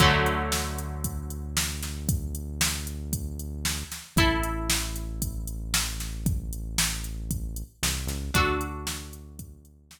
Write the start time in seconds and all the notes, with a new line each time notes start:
0.00 D2 D3 F#3 A3, kick, closed hi-hat
0.26 closed hi-hat
0.52 snare
0.78 closed hi-hat
1.04 kick, closed hi-hat
1.30 closed hi-hat
1.57 snare
1.82 snare, closed hi-hat
2.09 kick, closed hi-hat
2.35 closed hi-hat
2.61 snare
2.87 closed hi-hat
3.13 kick, closed hi-hat
3.39 closed hi-hat
3.65 snare
3.92 snare, closed hi-hat
4.16 A1 E4 A4, kick, closed hi-hat
4.43 closed hi-hat
4.70 snare
4.96 closed hi-hat
5.22 kick, closed hi-hat
5.47 closed hi-hat
5.74 snare
6.00 snare, closed hi-hat
6.26 kick, closed hi-hat
6.53 closed hi-hat
6.78 snare
7.04 closed hi-hat
7.31 kick, closed hi-hat
7.56 closed hi-hat
7.83 C2, snare
8.07 C#2, snare, closed hi-hat
8.34 D2 D4 F#4 A4, kick, closed hi-hat
8.61 closed hi-hat
8.87 snare
9.13 closed hi-hat
9.39 kick, closed hi-hat
9.65 closed hi-hat
9.91 snare